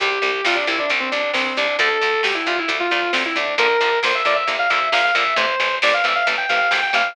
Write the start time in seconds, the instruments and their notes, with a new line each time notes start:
0.00 electric bass (finger) C2, overdriven guitar C3 G3, distortion guitar G4, kick, closed hi-hat
0.11 kick
0.22 electric bass (finger) C2, overdriven guitar C3 G3, kick, closed hi-hat
0.34 kick
0.44 electric bass (finger) C2, overdriven guitar C3 G3, distortion guitar F4, kick, snare
0.55 distortion guitar D4, kick
0.67 electric bass (finger) C2, overdriven guitar C3 G3, distortion guitar E4, kick, closed hi-hat
0.78 distortion guitar D4, kick
0.90 electric bass (finger) C2, overdriven guitar C3 G3, kick, closed hi-hat
1.00 distortion guitar C4, kick
1.11 electric bass (finger) C2, overdriven guitar C3 G3, distortion guitar D4, kick, closed hi-hat
1.23 kick
1.33 electric bass (finger) C2, overdriven guitar C3 G3, distortion guitar C4, kick, snare
1.45 distortion guitar C4, kick
1.57 electric bass (finger) C2, overdriven guitar C3 G3, distortion guitar D4, kick, closed hi-hat
1.68 kick
1.79 electric bass (finger) D2, overdriven guitar D3 A3, distortion guitar A4, kick, closed hi-hat
1.90 kick
2.01 electric bass (finger) D2, overdriven guitar D3 A3, kick, closed hi-hat
2.13 kick
2.23 electric bass (finger) D2, overdriven guitar D3 A3, distortion guitar G4, kick, snare
2.35 distortion guitar E4, kick
2.46 electric bass (finger) D2, overdriven guitar D3 A3, distortion guitar F4, kick, closed hi-hat
2.57 distortion guitar E4, kick
2.68 electric bass (finger) D2, overdriven guitar D3 A3, kick, closed hi-hat
2.80 distortion guitar F4, kick
2.91 electric bass (finger) D2, overdriven guitar D3 A3, distortion guitar F4, kick, closed hi-hat
3.03 kick
3.13 electric bass (finger) D2, overdriven guitar D3 A3, distortion guitar C4, kick, snare
3.25 distortion guitar E4, kick
3.36 electric bass (finger) D2, overdriven guitar D3 A3, distortion guitar D4, kick, open hi-hat
3.47 kick
3.58 electric bass (finger) A#1, overdriven guitar D3 F3 A#3, distortion guitar A#4, kick, closed hi-hat
3.69 kick
3.81 electric bass (finger) A#1, overdriven guitar D3 F3 A#3, kick, closed hi-hat
3.92 kick
4.03 electric bass (finger) A#1, overdriven guitar D3 F3 A#3, distortion guitar C5, kick, snare
4.14 distortion guitar E5, kick
4.25 electric bass (finger) A#1, overdriven guitar D3 F3 A#3, distortion guitar D5, kick, closed hi-hat
4.36 distortion guitar E5, kick
4.47 electric bass (finger) A#1, overdriven guitar D3 F3 A#3, kick, closed hi-hat
4.59 distortion guitar F5, kick
4.70 electric bass (finger) A#1, overdriven guitar D3 F3 A#3, distortion guitar E5, kick, closed hi-hat
4.81 kick
4.92 electric bass (finger) A#1, overdriven guitar D3 F3 A#3, distortion guitar F5, kick, snare
5.04 distortion guitar F5, kick
5.15 electric bass (finger) A#1, overdriven guitar D3 F3 A#3, distortion guitar E5, kick, closed hi-hat
5.26 kick
5.36 electric bass (finger) A1, overdriven guitar C3 E3 A3, distortion guitar C5, kick, closed hi-hat
5.49 kick
5.60 electric bass (finger) A1, overdriven guitar C3 E3 A3, kick, closed hi-hat
5.71 kick
5.82 electric bass (finger) A1, overdriven guitar C3 E3 A3, distortion guitar D5, kick, snare
5.93 distortion guitar F5, kick
6.04 electric bass (finger) A1, overdriven guitar C3 E3 A3, distortion guitar E5, kick, closed hi-hat
6.15 distortion guitar F5, kick
6.27 electric bass (finger) A1, overdriven guitar C3 E3 A3, kick, closed hi-hat
6.38 distortion guitar G5, kick
6.49 electric bass (finger) A1, overdriven guitar C3 E3 A3, distortion guitar F5, kick, closed hi-hat
6.60 kick
6.71 electric bass (finger) G#1, overdriven guitar C3 E3 A3, distortion guitar G5, kick, snare
6.83 distortion guitar G5, kick
6.93 electric bass (finger) A1, overdriven guitar C3 E3 A3, distortion guitar F5, kick, closed hi-hat
7.05 kick